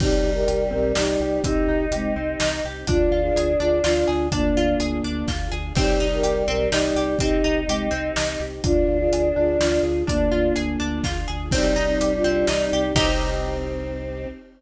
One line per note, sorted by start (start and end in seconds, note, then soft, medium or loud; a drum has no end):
0.00 0.20 C2 medium
0.00 1.38 G3 medium
0.00 2.85 C4 medium
0.00 0.22 C4 medium
0.00 0.30 D#4 loud
0.00 2.85 D#4 medium
0.00 0.30 G4 loud
0.00 2.85 G4 medium
0.00 kick loud
0.00 crash loud
0.24 0.45 C2 medium
0.24 0.45 D#4 medium
0.34 0.64 G4 medium
0.34 0.64 A#4 loud
0.47 0.69 C2 medium
0.47 0.69 G4 medium
0.47 closed hi-hat medium
0.71 0.93 B1 medium
0.71 0.92 C4 medium
0.71 0.92 G4 medium
0.71 0.92 A#4 loud
0.95 1.17 C2 medium
0.95 1.17 D#4 medium
0.95 1.42 D#4 loud
0.95 1.42 G4 loud
0.95 snare loud
1.20 1.40 C2 medium
1.20 1.43 G4 medium
1.43 1.64 C2 medium
1.43 1.67 C4 medium
1.43 1.85 D#4 loud
1.43 2.60 D#4 medium
1.43 1.85 G4 loud
1.43 kick loud
1.43 closed hi-hat loud
1.68 1.88 C2 medium
1.68 1.90 D#4 medium
1.91 2.12 C2 medium
1.91 2.15 G#3 medium
1.91 2.15 C4 medium
1.91 2.14 G4 medium
1.91 closed hi-hat medium
2.16 2.36 C2 medium
2.16 2.38 C4 medium
2.40 2.61 C2 medium
2.40 2.63 D#4 medium
2.40 snare loud
2.64 2.85 C2 medium
2.64 2.87 G4 medium
2.87 3.08 D2 medium
2.87 3.22 D4 loud
2.87 5.73 D4 medium
2.87 4.03 D4 loud
2.87 3.10 D4 medium
2.87 3.21 F4 loud
2.87 5.73 F4 medium
2.87 5.73 G#4 medium
2.87 kick loud
2.87 closed hi-hat loud
3.11 3.31 D2 medium
3.11 3.33 F4 medium
3.22 3.52 F4 medium
3.22 3.52 G#4 loud
3.35 3.56 D2 medium
3.35 3.58 G#4 medium
3.35 closed hi-hat loud
3.60 3.81 D2 medium
3.60 3.82 D4 medium
3.60 3.80 F4 medium
3.60 3.80 G#4 loud
3.84 4.04 D2 medium
3.84 4.27 D4 medium
3.84 4.27 F4 loud
3.84 4.06 F4 medium
3.84 snare loud
4.08 4.29 D2 medium
4.08 4.29 G#4 medium
4.31 4.52 D2 medium
4.31 5.30 A#3 loud
4.31 4.54 D4 medium
4.31 4.74 D4 medium
4.31 5.30 D4 loud
4.31 kick medium
4.31 closed hi-hat loud
4.55 4.75 D2 medium
4.55 4.79 F4 medium
4.80 5.00 D2 medium
4.80 5.02 G#4 medium
4.80 closed hi-hat medium
5.04 5.24 D2 medium
5.04 5.26 D4 medium
5.28 5.48 D2 medium
5.28 5.50 F4 medium
5.28 kick medium
5.28 snare medium
5.51 5.72 D2 medium
5.51 5.73 G#4 medium
5.75 5.96 C2 medium
5.75 7.14 G3 medium
5.75 8.61 C4 medium
5.75 5.98 C4 medium
5.75 8.61 D#4 medium
5.75 6.06 D#4 loud
5.75 8.61 G4 medium
5.75 6.06 G4 loud
5.75 kick loud
5.75 crash loud
6.00 6.21 C2 medium
6.00 6.22 D#4 medium
6.13 6.43 G4 medium
6.13 6.43 A#4 loud
6.23 6.44 C2 medium
6.23 6.45 G4 medium
6.23 closed hi-hat medium
6.48 6.68 B1 medium
6.48 6.69 C4 medium
6.48 6.69 G4 medium
6.48 6.69 A#4 loud
6.70 6.92 C2 medium
6.70 7.16 D#4 loud
6.70 6.94 D#4 medium
6.70 7.16 G4 loud
6.70 snare loud
6.95 7.16 C2 medium
6.95 7.18 G4 medium
7.18 7.41 C2 medium
7.18 7.42 C4 medium
7.18 7.60 D#4 loud
7.18 8.37 D#4 medium
7.18 7.60 G4 loud
7.18 kick loud
7.18 closed hi-hat loud
7.44 7.65 C2 medium
7.44 7.66 D#4 medium
7.67 7.88 C2 medium
7.67 7.88 G#3 medium
7.67 7.88 C4 medium
7.67 7.91 G4 medium
7.67 closed hi-hat medium
7.91 8.12 C2 medium
7.91 8.12 C4 medium
8.16 8.37 C2 medium
8.16 8.38 D#4 medium
8.16 snare loud
8.40 8.60 C2 medium
8.40 8.62 G4 medium
8.64 8.84 D2 medium
8.64 11.49 D4 medium
8.64 8.99 D4 loud
8.64 8.86 D4 medium
8.64 9.79 D4 loud
8.64 11.49 F4 medium
8.64 8.97 F4 loud
8.64 11.49 G#4 medium
8.64 kick loud
8.64 closed hi-hat loud
8.87 9.09 D2 medium
8.87 9.09 F4 medium
8.98 9.28 F4 medium
8.98 9.28 G#4 loud
9.11 9.32 D2 medium
9.11 9.34 G#4 medium
9.11 closed hi-hat loud
9.36 9.57 D2 medium
9.36 9.58 D4 medium
9.36 9.56 F4 medium
9.36 9.56 G#4 loud
9.59 9.80 D2 medium
9.59 10.04 D4 medium
9.59 10.04 F4 loud
9.59 9.82 F4 medium
9.59 snare loud
9.83 10.03 D2 medium
9.83 10.05 G#4 medium
10.07 10.29 D2 medium
10.07 11.05 A#3 loud
10.07 10.29 D4 medium
10.07 10.50 D4 medium
10.07 11.05 D4 loud
10.07 kick medium
10.07 closed hi-hat loud
10.31 10.52 D2 medium
10.31 10.53 F4 medium
10.56 10.77 D2 medium
10.56 10.77 G#4 medium
10.56 closed hi-hat medium
10.80 11.01 D2 medium
10.80 11.01 D4 medium
11.04 11.25 D2 medium
11.04 11.26 F4 medium
11.04 kick medium
11.04 snare medium
11.28 11.49 D2 medium
11.28 11.49 G#4 medium
11.51 11.72 C2 loud
11.51 12.86 G3 loud
11.51 12.95 C4 medium
11.51 11.74 C4 medium
11.51 11.79 C4 medium
11.51 12.95 D#4 medium
11.51 11.79 D#4 loud
11.51 12.95 G4 medium
11.51 kick loud
11.51 crash loud
11.76 11.97 C2 medium
11.76 11.97 D#4 medium
11.86 12.13 C4 medium
11.86 12.13 D#4 loud
12.00 12.21 C2 medium
12.00 12.22 G4 medium
12.00 closed hi-hat loud
12.16 12.47 D4 medium
12.16 12.47 F4 medium
12.24 12.45 C2 medium
12.24 12.46 C4 medium
12.47 12.69 C2 medium
12.47 12.70 D#4 medium
12.47 snare loud
12.62 12.93 C4 medium
12.62 12.93 D#4 medium
12.72 12.93 C2 medium
12.72 12.95 G4 medium
12.94 14.26 C2 loud
12.94 14.26 C4 loud
12.94 14.27 C4 loud
12.94 14.28 C4 loud
12.94 14.27 D#4 loud
12.94 14.28 D#4 loud
12.94 14.27 G4 loud
12.94 14.28 G4 loud
12.94 kick loud
12.94 crash loud